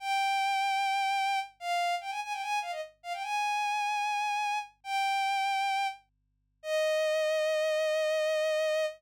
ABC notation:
X:1
M:4/4
L:1/16
Q:1/4=149
K:Eb
V:1 name="Violin"
g16 | f4 g a a g a2 f e z2 f g | a16 | "^rit." g10 z6 |
e16 |]